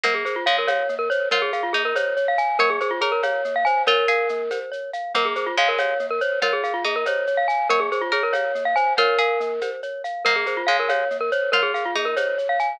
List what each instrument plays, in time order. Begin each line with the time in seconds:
0.04 pizzicato strings A#3, glockenspiel A#3 A#4, cowbell, low conga, shaker
0.14 glockenspiel G#4
0.25 glockenspiel G#4 C5, shaker
0.36 glockenspiel F4
0.46 pizzicato strings G#3, glockenspiel C#5 F5, shaker
0.58 glockenspiel A#4
0.67 glockenspiel C#5 F5, cowbell, high conga, shaker
0.89 glockenspiel A#3, shaker
0.99 glockenspiel A#4
1.10 glockenspiel C5 C#5, shaker
1.31 pizzicato strings F4, glockenspiel A#4 C#5, cowbell, low conga, shaker
1.42 glockenspiel G#4
1.53 glockenspiel G#4 F5, shaker
1.63 glockenspiel F4
1.73 glockenspiel A#3 G#4, pizzicato strings D#4, shaker
1.85 glockenspiel A#4
1.95 glockenspiel C5 C#5, cowbell, high conga, shaker
2.17 glockenspiel C#5, shaker
2.28 glockenspiel F5
2.38 glockenspiel F5 G#5, shaker
2.59 glockenspiel A#3 A#4, pizzicato strings C#5, cowbell, low conga, shaker
2.70 glockenspiel G#4
2.80 glockenspiel G#4 C5, shaker
2.91 glockenspiel F4
3.01 glockenspiel G#4 C#5, pizzicato strings A#4, shaker
3.12 glockenspiel A#4
3.23 glockenspiel C#5 F5, cowbell, high conga, shaker
3.45 glockenspiel A#3, shaker
3.56 glockenspiel F5
3.65 glockenspiel C5 G#5, shaker
3.87 pizzicato strings F4, glockenspiel A#4 C#5, cowbell, low conga, shaker
4.08 pizzicato strings G#4, glockenspiel F5, shaker
4.29 glockenspiel A#3, shaker
4.51 glockenspiel C5, cowbell, high conga, shaker
4.72 glockenspiel C#5, shaker
4.93 glockenspiel F5, shaker
5.15 glockenspiel A#3 A#4, pizzicato strings A#3, cowbell, low conga, shaker
5.25 glockenspiel G#4
5.35 glockenspiel G#4 C5, shaker
5.46 glockenspiel F4
5.57 pizzicato strings G#3, glockenspiel C#5 F5, shaker
5.68 glockenspiel A#4
5.78 glockenspiel C#5 F5, cowbell, high conga, shaker
5.99 glockenspiel A#3, shaker
6.10 glockenspiel A#4
6.21 glockenspiel C5 C#5, shaker
6.42 pizzicato strings F4, glockenspiel A#4 C#5, cowbell, low conga, shaker
6.53 glockenspiel G#4
6.64 glockenspiel G#4 F5, shaker
6.74 glockenspiel F4
6.84 glockenspiel A#3 G#4, pizzicato strings D#4, shaker
6.96 glockenspiel A#4
7.06 glockenspiel C5 C#5, cowbell, high conga, shaker
7.27 glockenspiel C#5, shaker
7.37 glockenspiel F5
7.48 glockenspiel F5 G#5, shaker
7.69 glockenspiel A#3 A#4, pizzicato strings C#5, cowbell, low conga, shaker
7.80 glockenspiel G#4
7.92 glockenspiel G#4 C5, shaker
8.01 glockenspiel F4
8.12 glockenspiel G#4 C#5, pizzicato strings A#4, shaker
8.23 glockenspiel A#4
8.33 glockenspiel C#5 F5, cowbell, high conga, shaker
8.55 glockenspiel A#3, shaker
8.65 glockenspiel F5
8.76 glockenspiel C5 G#5, shaker
8.97 pizzicato strings F4, glockenspiel A#4 C#5, cowbell, low conga, shaker
9.19 pizzicato strings G#4, glockenspiel F5, shaker
9.40 glockenspiel A#3, shaker
9.61 glockenspiel C5, cowbell, high conga, shaker
9.83 glockenspiel C#5, shaker
10.04 glockenspiel F5, shaker
10.25 glockenspiel A#3 A#4, pizzicato strings A#3, cowbell, low conga, shaker
10.36 glockenspiel G#4
10.46 glockenspiel G#4 C5, shaker
10.57 glockenspiel F4
10.67 pizzicato strings G#3, glockenspiel C#5 F5, shaker
10.79 glockenspiel A#4
10.89 glockenspiel C#5 F5, cowbell, high conga, shaker
11.10 glockenspiel A#3, shaker
11.21 glockenspiel A#4
11.32 glockenspiel C5 C#5, shaker
11.52 pizzicato strings F4, glockenspiel A#4 C#5, cowbell, low conga, shaker
11.63 glockenspiel G#4
11.74 glockenspiel G#4 F5, shaker
11.85 glockenspiel F4
11.95 glockenspiel A#3 G#4, pizzicato strings D#4, shaker
12.05 glockenspiel A#4
12.16 glockenspiel C5 C#5, cowbell, high conga, shaker
12.38 glockenspiel C#5, shaker
12.49 glockenspiel F5
12.59 glockenspiel F5 G#5, shaker